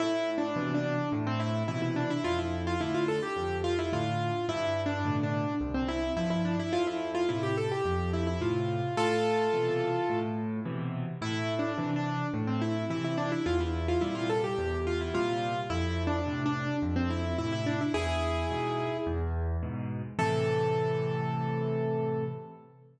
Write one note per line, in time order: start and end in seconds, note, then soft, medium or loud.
0.00 0.50 A2 loud
0.00 0.30 E4 loud
0.38 0.73 D4 medium
0.56 0.95 B2 medium
0.56 0.95 C3 medium
0.56 0.95 E3 medium
0.74 1.09 D4 medium
1.12 1.63 A2 loud
1.27 1.40 C4 loud
1.40 1.63 E4 medium
1.68 2.07 B2 medium
1.68 2.07 C3 medium
1.68 2.07 E3 medium
1.68 1.81 E4 medium
1.82 1.95 E4 medium
1.96 2.09 D4 medium
2.10 2.24 E4 loud
2.24 2.75 F2 medium
2.24 2.38 F4 loud
2.39 2.62 E4 medium
2.67 2.80 F4 medium
2.80 3.20 A2 medium
2.80 3.20 D3 medium
2.80 2.94 E4 medium
2.94 3.08 F4 medium
3.08 3.22 A4 medium
3.23 3.57 G4 medium
3.36 3.87 F2 medium
3.64 3.77 F4 loud
3.79 3.92 E4 medium
3.93 4.32 A2 medium
3.93 4.32 D3 medium
3.93 4.46 F4 medium
4.49 4.99 G2 loud
4.49 4.81 E4 loud
4.86 5.16 D4 medium
5.05 5.44 A2 medium
5.05 5.44 B2 medium
5.05 5.44 D3 medium
5.23 5.54 D4 medium
5.61 6.11 C2 loud
5.74 5.88 C4 medium
5.88 6.13 E4 loud
6.17 6.56 G2 medium
6.17 6.56 F3 medium
6.17 6.30 E4 medium
6.30 6.44 E4 medium
6.45 6.58 D4 medium
6.59 6.73 E4 loud
6.73 7.23 F2 loud
6.73 6.86 F4 loud
6.87 7.11 E4 medium
7.15 7.28 F4 loud
7.29 7.68 A2 medium
7.29 7.68 C3 medium
7.29 7.42 E4 medium
7.43 7.56 G4 medium
7.57 7.71 A4 medium
7.72 8.10 G4 medium
7.85 8.36 F2 loud
8.13 8.27 E4 medium
8.27 8.40 E4 medium
8.41 8.80 A2 medium
8.41 8.80 C3 medium
8.41 8.96 F4 medium
8.97 9.48 A2 loud
8.97 10.19 F4 loud
8.97 10.19 A4 loud
9.53 9.93 B2 medium
9.53 9.93 C3 medium
9.53 9.93 E3 medium
10.09 10.60 A2 loud
10.65 11.05 B2 medium
10.65 11.05 C3 medium
10.65 11.05 E3 medium
11.21 11.72 A2 loud
11.21 11.54 E4 loud
11.59 11.91 D4 medium
11.78 12.17 C3 medium
11.78 12.17 E3 medium
11.96 12.27 D4 medium
12.34 12.84 A2 loud
12.47 12.61 C4 medium
12.62 12.85 E4 medium
12.90 13.29 C3 medium
12.90 13.29 E3 medium
12.90 13.04 E4 medium
13.04 13.18 E4 medium
13.18 13.31 D4 loud
13.32 13.45 E4 medium
13.46 13.96 E2 loud
13.46 13.59 F4 loud
13.60 13.87 E4 medium
13.88 14.02 F4 medium
14.01 14.41 A#2 medium
14.01 14.41 C3 medium
14.01 14.41 G3 medium
14.01 14.15 E4 medium
14.15 14.28 F4 medium
14.30 14.43 A4 medium
14.44 14.80 G4 medium
14.58 15.08 E2 loud
14.87 15.00 F4 medium
15.01 15.14 E4 medium
15.14 15.53 A#2 medium
15.14 15.53 C3 medium
15.14 15.53 G3 medium
15.14 15.60 F4 loud
15.70 16.21 F2 loud
15.70 16.03 E4 loud
16.07 16.42 D4 medium
16.26 16.65 A2 medium
16.26 16.65 C3 medium
16.46 16.76 D4 loud
16.82 17.33 F2 loud
16.96 17.09 C4 loud
17.10 17.37 E4 medium
17.38 17.78 A2 medium
17.38 17.78 C3 medium
17.38 17.52 E4 loud
17.52 17.66 E4 loud
17.66 17.80 D4 medium
17.81 17.94 E4 medium
17.94 18.45 E2 medium
17.94 18.97 E4 loud
17.94 18.97 G#4 loud
18.50 18.90 G#2 medium
18.50 18.90 B2 medium
19.07 19.57 E2 loud
19.63 20.02 G#2 medium
19.63 20.02 B2 medium
20.19 22.24 A2 loud
20.19 22.24 C3 loud
20.19 22.24 E3 loud
20.19 22.24 A4 loud